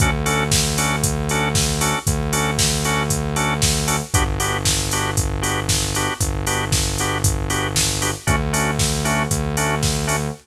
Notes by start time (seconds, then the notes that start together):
0.00 D2 C#4 D4 F#4 A4, kick, closed hi-hat
0.26 C#4 D4 F#4 A4, open hi-hat
0.52 kick, snare
0.78 C#4 D4 F#4 A4, open hi-hat
1.04 kick, closed hi-hat
1.29 C#4 D4 F#4 A4, open hi-hat
1.55 kick, snare
1.81 C#4 D4 F#4 A4, open hi-hat
2.07 D2, kick, closed hi-hat
2.33 C#4 D4 F#4 A4, open hi-hat
2.58 kick, snare
2.84 C#4 D4 F#4 A4, open hi-hat
3.10 kick, closed hi-hat
3.36 C#4 D4 F#4 A4, open hi-hat
3.62 kick, snare
3.87 C#4 D4 F#4 A4, open hi-hat
4.14 G1 B3 D4 F#4 G4, kick, closed hi-hat
4.40 B3 D4 F#4 G4, open hi-hat
4.65 kick, snare
4.91 B3 D4 F#4 G4, open hi-hat
5.17 kick, closed hi-hat
5.42 B3 D4 F#4 G4, open hi-hat
5.69 kick, snare
5.95 B3 D4 F#4 G4, open hi-hat
6.20 G1, kick, closed hi-hat
6.47 B3 D4 F#4 G4, open hi-hat
6.72 kick, snare
6.98 B3 D4 F#4 G4, open hi-hat
7.24 kick, closed hi-hat
7.50 B3 D4 F#4 G4, open hi-hat
7.76 kick, snare
8.02 B3 D4 F#4 G4, open hi-hat
8.27 D2 A3 C#4 D4 F#4, kick, closed hi-hat
8.53 A3 C#4 D4 F#4, open hi-hat
8.79 kick, snare
9.05 A3 C#4 D4 F#4, open hi-hat
9.31 D2, kick, closed hi-hat
9.57 A3 C#4 D4 F#4, open hi-hat
9.83 kick, snare
10.07 A3 C#4 D4 F#4, open hi-hat